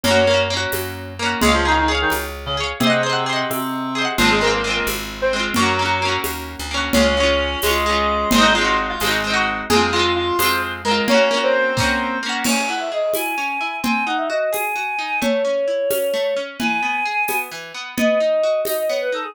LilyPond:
<<
  \new Staff \with { instrumentName = "Clarinet" } { \time 6/8 \key des \major \tempo 4. = 87 <des' des''>4 r2 | <aes aes'>16 <f f'>16 <ees ees'>16 <ees ees'>16 r16 <ees ees'>16 r8. <des des'>16 r8 | <c c'>4. <c c'>4. | <f f'>16 <aes aes'>16 <bes bes'>16 <bes bes'>16 r16 <bes bes'>16 r8. <c' c''>16 r8 |
<ges ges'>4. r4. | <des' des''>4. <aes aes'>4. | <c' c''>16 <ees' ees''>16 <f' f''>16 <f' f''>16 r16 <f' f''>16 r8. <ges' ges''>16 r8 | <aes' aes''>8 <f' f''>8 <f' f''>8 <c'' c'''>8 r8 <bes' bes''>8 |
<des' des''>8. <c' c''>4.~ <c' c''>16 r8 | \key cis \minor r2. | r2. | r2. |
r2. | r2. | }
  \new Staff \with { instrumentName = "Choir Aahs" } { \time 6/8 \key des \major r2. | r2. | r2. | r2. |
r2. | r2. | r2. | r2. |
r2. | \key cis \minor gis''8 fis''16 e''16 dis''8 gis''4. | gis''8 fis''16 e''16 dis''8 gis''4. | cis''2. |
gis''2 r4 | dis''4. dis''16 dis''16 cis''16 b'16 a'16 gis'16 | }
  \new Staff \with { instrumentName = "Orchestral Harp" } { \time 6/8 \key des \major <bes des' ges'>8 <bes des' ges'>8 <bes des' ges'>4. <bes des' ges'>8 | <aes' des'' f''>8 <aes' des'' f''>8 <aes' des'' f''>4. <aes' des'' f''>8 | <aes' c'' ees'' ges''>8 <aes' c'' ees'' ges''>8 <aes' c'' ees'' ges''>4. <aes' c'' ees'' ges''>8 | <aes c' f'>8 <aes c' f'>8 <aes c' f'>4. <aes c' f'>8 |
<bes des' ges'>8 <bes des' ges'>8 <bes des' ges'>4. <bes des' ges'>8 | <aes des' f'>8 <aes des' f'>4 <aes des' f'>8 <aes des' f'>4 | <aes c' ees' ges'>8 <aes c' ees' ges'>4 <aes c' ees' ges'>8 <aes c' ees' ges'>4 | <aes c' f'>8 <aes c' f'>4 <aes c' f'>4 <aes c' f'>8 |
<bes des' ges'>8 <bes des' ges'>4 <bes des' ges'>4 <bes des' ges'>8 | \key cis \minor cis'8 e'8 gis'8 e'8 cis'8 e'8 | bis8 dis'8 fis'8 gis'8 fis'8 dis'8 | a8 cis'8 e'8 cis'8 a8 cis'8 |
e8 b8 gis'8 b8 e8 b8 | b8 dis'8 fis'8 dis'8 b8 dis'8 | }
  \new Staff \with { instrumentName = "Electric Bass (finger)" } { \clef bass \time 6/8 \key des \major ges,4. ges,4. | des,4. des,4. | r2. | aes,,4. aes,,4. |
ges,4. ees,8. d,8. | des,4. des,4. | aes,,4. aes,,4. | f,4. f,4. |
r2. | \key cis \minor r2. | r2. | r2. |
r2. | r2. | }
  \new DrumStaff \with { instrumentName = "Drums" } \drummode { \time 6/8 cgl4. <cgho tamb>4. | cgl4. <cgho tamb>4. | cgl4. <cgho tamb>4. | cgl4. <cgho tamb>4. |
cgl4. <cgho tamb>4. | cgl4. <cgho tamb>4. | cgl4. <cgho tamb>4. | cgl4. <cgho tamb>4. |
cgl4. <bd sn>4. | <cgl cymc>4. <cgho tamb>4. | cgl4. <cgho tamb>4. | cgl4. <cgho tamb>4. |
cgl4. <cgho tamb>4. | cgl4. <cgho tamb>4. | }
>>